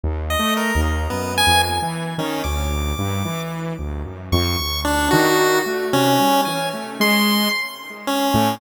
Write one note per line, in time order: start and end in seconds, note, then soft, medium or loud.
0.04 0.36 D#2 medium
0.30 0.54 D#5 medium
0.39 0.71 A3 medium
0.57 0.81 A#4 medium
0.75 1.07 D#2 loud
1.10 1.43 F#2 medium
1.10 1.34 B3 medium
1.38 1.62 G#5 loud
1.46 1.79 F2 medium
1.82 2.14 E3 medium
2.18 2.42 D#3 loud
2.18 2.43 C#4 medium
2.44 2.93 D2 medium
2.44 3.40 D6 medium
2.98 3.23 G2 medium
3.25 3.73 E3 medium
3.79 4.03 D2 medium
4.05 4.29 F#2 medium
4.32 4.56 F2 loud
4.32 4.81 C#6 medium
4.59 5.07 D2 medium
4.85 5.09 D4 loud
5.11 5.61 D#3 loud
5.11 5.59 F#4 medium
5.66 5.90 A3 medium
5.93 6.17 C3 medium
5.93 6.41 C#4 loud
6.20 6.44 G3 medium
6.45 6.71 E3 medium
6.45 6.69 G#5 medium
6.73 6.97 A3 medium
7.00 7.48 G#3 loud
7.00 7.49 C6 loud
8.07 8.55 C#4 medium
8.34 8.58 A2 loud